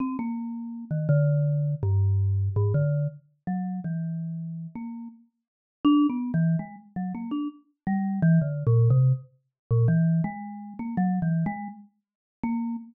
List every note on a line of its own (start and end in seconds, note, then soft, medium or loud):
0.00 0.17 C4 medium
0.19 0.85 A#3 medium
0.91 1.07 D#3 medium
1.09 1.75 D3 loud
1.83 2.49 G2 loud
2.56 2.73 G#2 loud
2.74 3.07 D3 loud
3.47 3.80 F#3 medium
3.84 4.67 E3 medium
4.75 5.08 A#3 medium
5.85 6.07 D4 loud
6.10 6.32 B3 medium
6.34 6.56 E3 medium
6.59 6.76 G#3 medium
6.96 7.13 F#3 medium
7.15 7.31 A#3 medium
7.31 7.48 D4 medium
7.87 8.20 G3 loud
8.22 8.39 E3 loud
8.41 8.63 D3 medium
8.67 8.89 A#2 loud
8.90 9.12 C3 loud
9.71 9.87 A#2 loud
9.88 10.21 E3 loud
10.24 10.74 G#3 loud
10.79 10.96 A#3 medium
10.97 11.19 F#3 loud
11.22 11.44 E3 medium
11.46 11.68 G#3 loud
12.43 12.76 A#3 loud